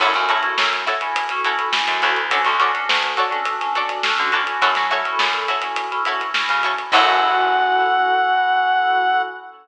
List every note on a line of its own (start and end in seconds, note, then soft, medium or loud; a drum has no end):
0.00 0.14 F#2 medium
0.00 0.11 C#4 medium
0.00 0.11 E4 medium
0.00 0.10 E4 loud
0.00 0.11 F#4 medium
0.00 0.10 F#4 loud
0.00 0.11 A4 loud
0.00 0.10 A4 loud
0.00 0.10 C#5 loud
0.00 kick medium
0.00 crash medium
0.14 0.41 F#2 medium
0.14 0.26 C#4 medium
0.14 0.26 E4 medium
0.14 0.26 F#4 medium
0.14 0.26 A4 medium
0.14 kick medium
0.14 snare soft
0.14 closed hi-hat medium
0.29 0.41 C#4 medium
0.29 0.49 E4 medium
0.29 0.41 E4 medium
0.29 0.41 F#4 medium
0.29 0.49 F#4 medium
0.29 0.41 A4 medium
0.29 0.49 A4 medium
0.29 0.49 C#5 medium
0.29 closed hi-hat medium
0.43 0.89 C#4 medium
0.43 0.89 E4 medium
0.43 0.89 F#4 medium
0.43 0.89 A4 medium
0.43 closed hi-hat medium
0.58 0.84 F#2 medium
0.58 snare medium
0.73 closed hi-hat medium
0.86 1.07 E4 medium
0.86 1.07 F#4 medium
0.86 1.07 A4 medium
0.86 1.07 C#5 medium
0.86 snare soft
0.86 closed hi-hat medium
1.01 1.24 C#4 medium
1.01 1.24 E4 medium
1.01 1.24 F#4 medium
1.01 1.24 A4 medium
1.01 closed hi-hat medium
1.16 kick medium
1.16 closed hi-hat loud
1.29 1.42 C#4 medium
1.29 1.42 E4 medium
1.29 1.42 F#4 medium
1.29 1.42 A4 medium
1.29 snare soft
1.29 closed hi-hat medium
1.44 1.68 C#4 medium
1.44 1.65 E4 medium
1.44 1.68 E4 medium
1.44 1.68 F#4 medium
1.44 1.65 F#4 medium
1.44 1.68 A4 medium
1.44 1.65 A4 medium
1.44 1.65 C#5 medium
1.44 closed hi-hat medium
1.59 kick medium
1.59 closed hi-hat medium
1.72 2.19 C#4 medium
1.72 2.19 E4 medium
1.72 2.19 F#4 medium
1.72 2.19 A4 medium
1.72 snare medium
1.88 2.02 F#2 medium
1.88 closed hi-hat medium
2.02 2.45 D2 loud
2.02 2.12 E4 medium
2.02 2.12 F#4 medium
2.02 2.12 A4 medium
2.02 2.12 C#5 medium
2.02 closed hi-hat medium
2.16 closed hi-hat medium
2.30 2.42 C#4 medium
2.30 2.42 D4 medium
2.30 2.42 F#4 medium
2.30 2.41 F#4 loud
2.30 2.42 A4 medium
2.30 2.41 A4 medium
2.30 2.41 C#5 medium
2.30 2.41 D5 loud
2.30 kick medium
2.30 closed hi-hat medium
2.44 2.72 D2 medium
2.44 2.56 C#4 medium
2.44 2.56 D4 medium
2.44 2.56 F#4 medium
2.44 2.56 A4 medium
2.44 kick medium
2.44 snare soft
2.44 closed hi-hat medium
2.59 2.71 C#4 medium
2.59 2.71 D4 medium
2.59 2.71 F#4 medium
2.59 2.80 F#4 medium
2.59 2.71 A4 medium
2.59 2.80 A4 medium
2.59 2.80 C#5 medium
2.59 2.80 D5 medium
2.59 snare soft
2.59 closed hi-hat medium
2.74 3.20 C#4 medium
2.74 3.20 D4 medium
2.74 3.20 F#4 medium
2.74 3.20 A4 medium
2.74 closed hi-hat medium
2.89 3.15 D2 medium
2.89 snare medium
3.03 closed hi-hat medium
3.17 3.37 F#4 medium
3.17 3.37 A4 medium
3.17 3.37 C#5 medium
3.17 3.37 D5 medium
3.17 closed hi-hat medium
3.31 3.54 C#4 medium
3.31 3.54 D4 medium
3.31 3.54 F#4 medium
3.31 3.54 A4 medium
3.31 closed hi-hat medium
3.45 kick medium
3.45 closed hi-hat medium
3.60 3.72 C#4 medium
3.60 3.72 D4 medium
3.60 3.72 F#4 medium
3.60 3.72 A4 medium
3.60 snare soft
3.60 closed hi-hat medium
3.75 3.98 C#4 medium
3.75 3.98 D4 medium
3.75 3.95 F#4 medium
3.75 3.98 F#4 medium
3.75 3.98 A4 medium
3.75 3.95 A4 medium
3.75 3.95 C#5 medium
3.75 3.95 D5 medium
3.75 closed hi-hat medium
3.89 kick medium
3.89 closed hi-hat medium
4.03 4.31 C#4 medium
4.03 4.31 D4 medium
4.03 4.31 F#4 medium
4.03 4.31 A4 medium
4.03 snare medium
4.18 4.45 D3 medium
4.18 closed hi-hat medium
4.32 4.73 C#4 medium
4.32 4.73 E4 medium
4.32 4.73 F#4 loud
4.32 4.43 F#4 medium
4.32 4.73 A4 medium
4.32 4.43 A4 medium
4.32 4.43 C#5 medium
4.32 4.43 D5 medium
4.32 closed hi-hat medium
4.47 closed hi-hat medium
4.61 4.75 F#2 medium
4.61 4.71 E4 loud
4.61 4.71 F#4 loud
4.61 4.71 A4 loud
4.61 4.71 C#5 loud
4.61 kick medium
4.61 closed hi-hat medium
4.75 5.03 F#3 medium
4.75 4.88 C#4 medium
4.75 4.88 E4 medium
4.75 4.88 F#4 medium
4.75 4.88 A4 medium
4.75 kick medium
4.75 snare medium
4.75 closed hi-hat medium
4.90 5.02 C#4 medium
4.90 5.02 E4 medium
4.90 5.11 E4 medium
4.90 5.02 F#4 medium
4.90 5.11 F#4 medium
4.90 5.02 A4 medium
4.90 5.11 A4 medium
4.90 5.11 C#5 medium
4.90 closed hi-hat medium
5.05 5.52 C#4 medium
5.05 5.52 E4 medium
5.05 5.52 F#4 medium
5.05 5.52 A4 medium
5.05 closed hi-hat medium
5.19 5.46 F#2 medium
5.19 snare medium
5.33 closed hi-hat medium
5.48 5.68 E4 medium
5.48 5.68 F#4 medium
5.48 5.68 A4 medium
5.48 5.68 C#5 medium
5.48 closed hi-hat medium
5.62 5.85 C#4 medium
5.62 5.85 E4 medium
5.62 5.85 F#4 medium
5.62 5.85 A4 medium
5.62 closed hi-hat medium
5.76 kick medium
5.76 closed hi-hat medium
5.91 6.03 C#4 medium
5.91 6.03 E4 medium
5.91 6.03 F#4 medium
5.91 6.03 A4 medium
5.91 closed hi-hat medium
6.05 6.29 C#4 medium
6.05 6.29 E4 medium
6.05 6.26 E4 medium
6.05 6.29 F#4 medium
6.05 6.26 F#4 medium
6.05 6.29 A4 medium
6.05 6.26 A4 medium
6.05 6.26 C#5 medium
6.05 closed hi-hat medium
6.21 kick medium
6.21 closed hi-hat medium
6.34 6.81 C#4 medium
6.34 6.81 E4 medium
6.34 6.81 F#4 medium
6.34 6.81 A4 medium
6.34 snare medium
6.49 6.76 C#3 medium
6.49 snare soft
6.49 closed hi-hat medium
6.63 6.74 E4 medium
6.63 6.74 F#4 medium
6.63 6.74 A4 medium
6.63 6.74 C#5 medium
6.63 closed hi-hat medium
6.78 closed hi-hat medium
6.92 9.23 F#2 loud
6.92 9.22 C#4 loud
6.92 9.22 E4 medium
6.92 9.22 E4 loud
6.92 9.22 F#4 loud
6.92 9.22 A4 loud
6.92 9.22 C#5 loud
6.92 9.22 F#5 loud
6.92 kick loud
6.92 crash loud